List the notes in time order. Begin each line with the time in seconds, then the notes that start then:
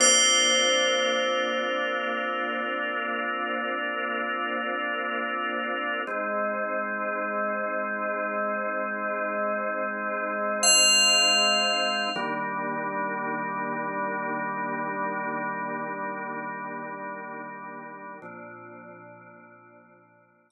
0.00 A#3 C4 D4 F4 C5
6.07 G#3 C4 D#4
10.63 F5
12.16 D#3 G3 A#3 D4
18.22 A#2 F3 C4 D4
20.50 A#5